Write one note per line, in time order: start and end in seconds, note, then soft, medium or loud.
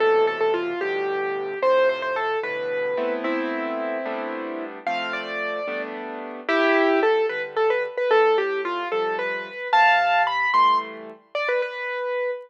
0.00 0.73 A2 medium
0.00 0.73 B2 medium
0.00 0.73 C3 medium
0.00 0.73 E3 medium
0.00 0.25 A4 loud
0.27 0.40 A4 loud
0.41 0.53 A4 medium
0.54 0.80 F4 medium
0.81 1.54 G2 medium
0.81 1.54 A2 medium
0.81 1.54 B2 medium
0.81 1.54 D3 medium
0.81 1.59 G4 loud
1.62 2.35 F2 medium
1.62 2.35 A2 medium
1.62 2.35 C3 medium
1.62 1.89 C5 loud
1.89 2.02 C5 medium
2.02 2.15 C5 medium
2.16 2.39 A4 loud
2.43 2.95 G2 medium
2.43 2.95 A2 medium
2.43 2.95 B2 medium
2.43 2.95 D3 medium
2.43 3.14 B4 medium
2.97 3.97 A3 medium
2.97 3.97 B3 medium
2.97 3.97 C4 medium
2.97 3.97 E4 medium
3.24 4.64 C4 medium
3.24 4.64 E4 loud
4.06 4.78 G3 loud
4.06 4.78 A3 medium
4.06 4.78 B3 medium
4.06 4.78 D4 medium
4.87 5.60 F3 medium
4.87 5.60 A3 medium
4.87 5.60 C4 medium
4.87 5.13 F5 loud
5.13 5.82 D5 medium
5.68 6.41 G3 medium
5.68 6.41 A3 medium
5.68 6.41 B3 medium
5.68 6.41 D4 medium
6.49 7.22 C2 loud
6.49 7.00 E4 loud
6.49 7.00 G4 loud
7.03 7.26 A4 loud
7.29 7.86 D3 medium
7.29 7.86 G3 medium
7.29 7.42 B4 medium
7.57 7.69 A4 loud
7.70 7.83 B4 medium
7.98 8.10 B4 medium
8.11 8.84 A2 medium
8.11 8.37 A4 loud
8.38 8.61 G4 medium
8.65 8.88 F4 loud
8.92 9.49 C3 medium
8.92 9.49 F3 medium
8.92 9.49 G3 medium
8.92 9.16 A4 medium
9.19 9.68 B4 loud
9.73 10.46 C3 medium
9.73 10.23 F5 loud
9.73 10.23 A5 loud
10.27 10.51 B5 loud
10.54 11.11 E3 medium
10.54 11.11 G3 medium
10.54 11.11 A3 medium
10.54 10.78 C6 loud
11.35 11.48 D5 loud
11.49 11.61 B4 medium
11.62 12.31 B4 loud